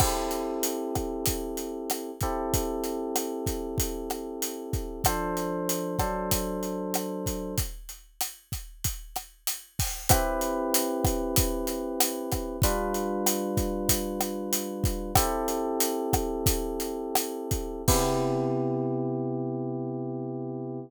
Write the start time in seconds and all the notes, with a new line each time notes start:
0.00 C4 E4 G4 A4, kick, cross-stick, crash
0.31 closed hi-hat
0.63 closed hi-hat
0.95 kick, cross-stick, closed hi-hat
1.26 kick, closed hi-hat
1.57 closed hi-hat
1.90 cross-stick, closed hi-hat
2.21 C4 E4 G4 A4, kick, closed hi-hat
2.54 kick, closed hi-hat
2.84 closed hi-hat
3.16 cross-stick, closed hi-hat
3.46 kick, closed hi-hat
3.78 kick, closed hi-hat
4.10 cross-stick, closed hi-hat
4.42 closed hi-hat
4.73 kick, closed hi-hat
5.04 F3 D4 A4 C5, kick, cross-stick, closed hi-hat
5.37 closed hi-hat
5.69 closed hi-hat
5.99 F#3 D4 A4 C5, kick, cross-stick, closed hi-hat
6.31 kick, closed hi-hat
6.63 closed hi-hat
6.94 cross-stick, closed hi-hat
7.26 kick, closed hi-hat
7.58 kick, closed hi-hat
7.89 closed hi-hat
8.21 cross-stick, closed hi-hat
8.52 kick, closed hi-hat
8.84 kick, closed hi-hat
9.16 cross-stick, closed hi-hat
9.47 closed hi-hat
9.79 kick, open hi-hat
10.09 C4 E4 G4 B4, kick, cross-stick, closed hi-hat
10.41 closed hi-hat
10.74 closed hi-hat
11.04 kick, cross-stick, closed hi-hat
11.36 kick, closed hi-hat
11.67 closed hi-hat
12.00 cross-stick, closed hi-hat
12.32 kick, cross-stick, closed hi-hat
12.62 G3 D4 F4 B4, kick, closed hi-hat
12.94 closed hi-hat
13.26 cross-stick, closed hi-hat
13.57 kick, closed hi-hat
13.89 kick, closed hi-hat
14.21 cross-stick, closed hi-hat
14.53 closed hi-hat
14.84 kick, closed hi-hat
15.15 C4 E4 G4 A4, kick, cross-stick, closed hi-hat
15.48 closed hi-hat
15.80 closed hi-hat
16.13 kick, cross-stick, closed hi-hat
16.46 kick, closed hi-hat
16.80 closed hi-hat
17.15 cross-stick, closed hi-hat
17.51 kick, closed hi-hat
17.88 C3 B3 E4 G4, kick, crash